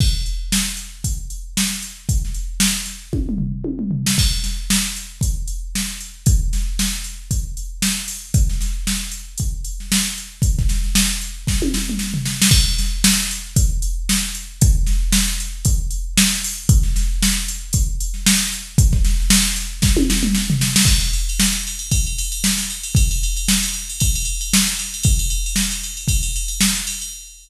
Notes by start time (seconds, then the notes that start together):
0.00 kick, crash
0.26 closed hi-hat
0.52 snare
0.77 closed hi-hat
1.04 kick, closed hi-hat
1.30 closed hi-hat
1.57 snare
1.71 snare
1.82 closed hi-hat
2.09 kick, closed hi-hat
2.25 snare
2.34 closed hi-hat
2.60 snare
2.86 snare, closed hi-hat
3.13 kick, high tom
3.29 mid tom
3.38 floor tom
3.64 high tom
3.79 mid tom
3.91 floor tom
4.06 snare
4.18 kick, crash
4.31 snare
4.44 snare, closed hi-hat
4.70 snare
4.96 closed hi-hat
5.21 kick, closed hi-hat
5.47 closed hi-hat
5.75 snare
6.00 closed hi-hat
6.26 kick, closed hi-hat
6.53 snare, closed hi-hat
6.79 snare
6.92 snare
7.04 closed hi-hat
7.31 kick, closed hi-hat
7.57 closed hi-hat
7.82 snare
8.08 open hi-hat
8.34 kick, closed hi-hat
8.49 snare
8.61 snare, closed hi-hat
8.87 snare
9.12 closed hi-hat
9.38 kick, closed hi-hat
9.64 closed hi-hat
9.80 snare
9.92 snare
10.18 closed hi-hat
10.42 kick, closed hi-hat
10.59 kick, snare
10.69 snare, closed hi-hat
10.84 snare
10.95 snare
11.21 closed hi-hat
11.47 kick, snare
11.62 high tom
11.74 snare
11.89 mid tom
11.99 snare
12.14 floor tom
12.25 snare
12.42 snare
12.51 kick, crash
12.67 snare
12.78 snare, closed hi-hat
13.04 snare
13.31 closed hi-hat
13.56 kick, closed hi-hat
13.82 closed hi-hat
14.09 snare
14.35 closed hi-hat
14.61 kick, closed hi-hat
14.87 snare, closed hi-hat
15.12 snare
15.27 snare
15.40 closed hi-hat
15.65 kick, closed hi-hat
15.91 closed hi-hat
16.17 snare
16.44 open hi-hat
16.69 kick, closed hi-hat
16.83 snare
16.96 snare, closed hi-hat
17.22 snare
17.48 closed hi-hat
17.73 kick, closed hi-hat
18.00 closed hi-hat
18.14 snare
18.26 snare
18.53 closed hi-hat
18.78 kick, closed hi-hat
18.92 kick, snare
19.05 snare, closed hi-hat
19.20 snare
19.30 snare
19.56 closed hi-hat
19.82 kick, snare
19.97 high tom
20.10 snare
20.23 mid tom
20.35 snare
20.50 floor tom
20.61 snare
20.76 snare
20.85 kick, crash
21.00 ride
21.13 ride
21.29 ride
21.40 snare
21.53 ride
21.67 ride
21.79 ride
21.91 kick, ride
22.07 ride
22.18 ride
22.32 ride
22.44 snare
22.57 snare, ride
22.70 ride
22.83 ride
22.95 kick, ride
23.11 ride
23.23 ride
23.37 ride
23.48 snare
23.63 ride
23.74 ride
23.89 ride
24.00 kick, ride
24.15 ride
24.25 ride
24.41 ride
24.53 snare
24.67 snare, ride
24.79 ride
24.94 ride
25.03 kick, ride
25.19 ride
25.30 ride
25.46 ride
25.56 snare
25.71 ride
25.83 ride
25.97 ride
26.08 kick, ride
26.23 ride
26.36 ride
26.48 ride
26.61 snare
26.75 snare, ride
26.87 ride
27.01 ride